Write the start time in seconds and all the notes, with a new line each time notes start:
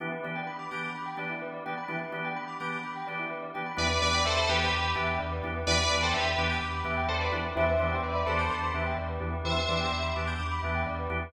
0.00 E3 B3 D4 E4 G4
0.12 B4
0.24 E3 B3 D4 G4 D5
0.35 G5
0.47 B5
0.59 D6
0.71 E3 B3 D4 G4 G6
0.83 D6
0.95 B5
1.06 G5
1.17 E3 B3 D4 G4 D5
1.30 E4
1.42 B4
1.54 D5
1.66 E3 B3 D4 G4 G5
1.77 B5
1.88 E3 B3 D4 E4 G4
2.01 B4
2.12 E3 B3 D4 G4 D5
2.25 G5
2.36 B5
2.48 D6
2.60 E3 B3 D4 G4 G6
2.72 D6
2.83 B5
2.96 G5
3.07 E3 B3 D4 G4 D5
3.19 E4
3.30 B4
3.42 D5
3.54 E3 B3 D4 G4 G5
3.66 B5
3.77 E2 E3 B3 D4 E4 G4 B4 D5
3.90 B4
4.01 E2 E3 B3 D4 G4 B4 D5
4.14 G5
4.25 E2 A4 C5 E5
4.37 A4 C5 B5
4.49 E2 E3 B3 D4 G4 B4 D6
4.61 G6
4.73 E2 D6
4.84 B5
4.95 E2 E3 B3 D4 G4 E5
5.07 G5
5.19 E2 D5
5.32 B4
5.43 E2 E3 B3 D4 E4 G4
5.56 B4
5.67 E2 E3 B3 D4 E4 G4 B4 D5
5.79 B4
5.91 E2 E3 B3 D4 G4 D5
6.02 A4 C5 G5
6.14 E2 G4 B4 E5
6.26 B5
6.38 E2 E3 B3 D4 G4 D6
6.50 G6
6.61 E2 D6
6.74 B5
6.84 E2 E3 B3 D4 G4 E5
6.97 G5
7.08 E2 A4 C5 D5
7.20 B4 D5
7.32 E2 E3 B3 D4 E4 G4
7.44 B4
7.55 E2 E3 B3 D4 E4 G4 C5 E5
7.68 B4
7.79 E2 E3 B3 D4 G4 C5 D5 E5
7.91 G5
8.03 E2 B4 D5 E5
8.15 B4 D5 B5
8.26 E2 E3 B3 D4 G4 A4 C5 D6
8.39 G6
8.50 E2 D6
8.63 B5
8.74 E2 E3 B3 D4 G4 E5
8.86 G5
8.98 E2 D5
9.09 B4
9.20 E2 E3 B3 D4 E4 G4
9.33 B4
9.45 E2 E3 B3 D4 E4 G4 C5 E5
9.56 B4
9.69 E2 E3 B3 D4 G4 D5
9.80 G5
9.92 E2 E5
10.04 B5
10.16 E2 E3 B3 D4 G4 D6
10.27 G6
10.39 E2 D6
10.51 B5
10.63 E2 E3 B3 D4 G4 E5
10.75 G5
10.86 E2 D5
10.99 B4
11.10 E2 E3 B3 D4 E4 G4
11.22 B4